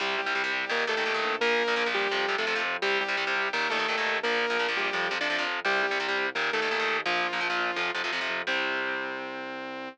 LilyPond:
<<
  \new Staff \with { instrumentName = "Lead 2 (sawtooth)" } { \time 4/4 \key c \dorian \tempo 4 = 170 <g g'>8 <g g'>4. <bes bes'>8 <a a'>4. | <bes bes'>4. <g g'>4~ <g g'>16 <a a'>8. r8 | <g g'>8 <g g'>4. <bes bes'>8 <a a'>4. | <bes bes'>4. <g g'>4~ <g g'>16 <d' d''>8. r8 |
<g g'>8 <g g'>4. <bes bes'>8 <a a'>4. | <f f'>2~ <f f'>8 r4. | c'1 | }
  \new Staff \with { instrumentName = "Overdriven Guitar" } { \clef bass \time 4/4 \key c \dorian <c g>8. <c g>16 <c g>16 <c g>8. <bes, ees>8 <bes, ees>16 <bes, ees>16 <bes, ees>16 <bes, ees>8. | <bes, f>8. <bes, f>16 <bes, f>16 <bes, f>8. <c f>8 <c f>16 <c f>16 <c f>16 <c f>8. | <c g>8. <c g>16 <c g>16 <c g>8. <bes, ees>8 <bes, ees>16 <bes, ees>16 <bes, ees>16 <bes, ees>8. | <bes, f>8. <bes, f>16 <bes, f>16 <bes, f>8. <c f>8 <c f>16 <c f>16 <c f>16 <c f>8. |
<c g>8. <c g>16 <c g>16 <c g>8. <bes, ees>8 <bes, ees>16 <bes, ees>16 <bes, ees>16 <bes, ees>8. | <bes, f>8. <bes, f>16 <bes, f>16 <bes, f>8. <c f>8 <c f>16 <c f>16 <c f>16 <c f>8. | <c g>1 | }
  \new Staff \with { instrumentName = "Synth Bass 1" } { \clef bass \time 4/4 \key c \dorian c,8 c,8 c,8 c,8 ees,8 ees,8 ees,8 bes,,8~ | bes,,8 bes,,8 bes,,8 bes,,8 f,8 f,8 f,8 f,8 | c,8 c,8 c,8 c,8 ees,8 ees,8 ees,8 ees,8 | bes,,8 bes,,8 bes,,8 bes,,8 f,8 f,8 f,8 f,8 |
c,8 c,8 c,8 c,8 ees,8 ees,8 ees,8 ees,8 | bes,,8 bes,,8 bes,,8 bes,,8 f,8 f,8 f,8 f,8 | c,1 | }
>>